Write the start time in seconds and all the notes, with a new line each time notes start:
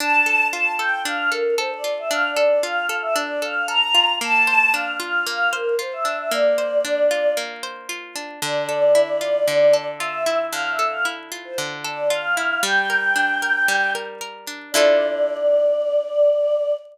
0.00 D4 A5
0.26 A4
0.50 F4 A5
0.78 A4 G5
1.05 D4 F5
1.31 A4 A#4
1.58 A4 C5
1.70 D5
1.84 F4
1.98 E5
2.11 D4 F5
2.28 D5
2.36 A4
2.46 D5
2.63 F4 F5
2.89 A4
3.02 E5
3.15 D4 D5
3.42 A4 F5
3.68 A4 A#5
3.95 F4
4.21 A#3 A5
4.47 C5
4.74 D4 F5
5.00 F4 F5
5.27 A#3 F5
5.53 A#4 C5
5.79 F4 C5
5.93 E5
6.05 D4
6.17 E5
6.31 A#3 D5
6.58 C5
6.85 D4
7.11 F4
7.37 A#3
7.63 C5
7.89 F4
8.16 D4
8.42 D3 D5
8.69 A4
8.95 E4
9.21 F4
9.48 D3
9.73 A4
9.98 F4 E5
10.26 E4
10.52 D3 F5
10.71 E5
10.79 A4
10.89 F5
11.05 E4
11.32 F4
11.45 C5
11.58 D3
11.84 A4 D5
12.10 F4 F5
12.37 E4
12.63 G3 G5
12.90 A#4
13.16 D4
13.42 A#4
13.68 G3
13.95 A#4
14.21 A#4
14.47 D4
14.72 D3 E4 D5
14.76 F4 A4